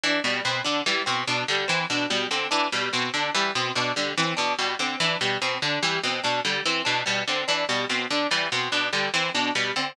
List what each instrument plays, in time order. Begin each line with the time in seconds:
0.04 pizzicato strings E3, harpsichord D4
0.24 pizzicato strings B2, harpsichord G3
0.45 pizzicato strings B2, harpsichord C4
0.64 pizzicato strings D3, harpsichord D4
0.86 pizzicato strings E3, harpsichord G3
1.06 pizzicato strings B2, harpsichord C4
1.27 pizzicato strings B2, harpsichord D4
1.48 pizzicato strings D3, harpsichord G3
1.68 pizzicato strings E3, harpsichord C4
1.90 pizzicato strings B2, harpsichord D4
2.10 pizzicato strings B2, harpsichord G3
2.31 pizzicato strings D3, harpsichord C4
2.51 pizzicato strings E3, harpsichord D4
2.72 pizzicato strings B2, harpsichord G3
2.93 pizzicato strings B2, harpsichord C4
3.14 pizzicato strings D3, harpsichord D4
3.35 pizzicato strings E3, harpsichord G3
3.55 pizzicato strings B2, harpsichord C4
3.75 pizzicato strings B2, harpsichord D4
3.96 pizzicato strings D3, harpsichord G3
4.17 pizzicato strings E3, harpsichord C4
4.37 pizzicato strings B2, harpsichord D4
4.59 pizzicato strings B2, harpsichord G3
4.79 pizzicato strings D3, harpsichord C4
5.00 pizzicato strings E3, harpsichord D4
5.21 pizzicato strings B2, harpsichord G3
5.42 pizzicato strings B2, harpsichord C4
5.62 pizzicato strings D3, harpsichord D4
5.82 pizzicato strings E3, harpsichord G3
6.04 pizzicato strings B2, harpsichord C4
6.24 pizzicato strings B2, harpsichord D4
6.45 pizzicato strings D3, harpsichord G3
6.66 pizzicato strings E3, harpsichord C4
6.85 pizzicato strings B2, harpsichord D4
7.06 pizzicato strings B2, harpsichord G3
7.28 pizzicato strings D3, harpsichord C4
7.48 pizzicato strings E3, harpsichord D4
7.69 pizzicato strings B2, harpsichord G3
7.89 pizzicato strings B2, harpsichord C4
8.11 pizzicato strings D3, harpsichord D4
8.31 pizzicato strings E3, harpsichord G3
8.52 pizzicato strings B2, harpsichord C4
8.72 pizzicato strings B2, harpsichord D4
8.93 pizzicato strings D3, harpsichord G3
9.14 pizzicato strings E3, harpsichord C4
9.34 pizzicato strings B2, harpsichord D4
9.55 pizzicato strings B2, harpsichord G3
9.76 pizzicato strings D3, harpsichord C4